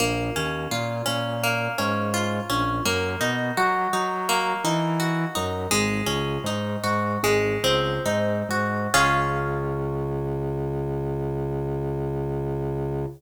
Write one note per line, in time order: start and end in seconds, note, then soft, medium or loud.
0.00 0.30 A#1 loud
0.00 1.43 A#3 medium
0.36 0.67 D#2 medium
0.36 1.05 C#4 medium
0.71 1.02 A#2 medium
0.71 2.13 F4 medium
1.06 1.68 A#2 medium
1.06 1.78 C#4 medium
1.43 2.79 A#3 medium
1.78 2.40 G#2 medium
1.78 2.49 C#4 medium
2.14 2.82 F4 medium
2.50 2.80 A#1 medium
2.50 2.83 C#4 medium
2.85 3.16 F#2 loud
2.85 4.28 A#3 medium
3.21 3.51 B2 medium
3.21 3.93 D#4 medium
3.57 3.88 F#3 medium
3.57 4.99 F#4 medium
3.93 4.54 F#3 medium
3.93 4.64 D#4 medium
4.29 5.65 A#3 medium
4.64 5.25 E3 medium
4.64 5.35 D#4 medium
5.00 5.68 F#4 medium
5.35 5.67 F#2 medium
5.35 5.69 D#4 medium
5.71 6.02 G#1 loud
5.71 7.14 G#3 loud
6.06 6.38 C#2 medium
6.06 7.15 C#4 medium
6.44 6.76 G#2 medium
6.44 7.20 D#4 medium
6.84 7.17 G#2 medium
6.84 7.21 F#4 medium
7.23 7.57 G#1 medium
7.23 8.86 G#3 medium
7.64 7.99 C#2 medium
7.64 8.88 C4 medium
8.06 8.43 G#2 medium
8.06 8.90 D#4 medium
8.49 8.87 G#2 medium
8.49 8.93 F#4 medium
8.94 13.05 C#2 loud
8.94 13.06 C#4 medium
8.94 13.06 F4 loud
8.94 13.06 G#4 loud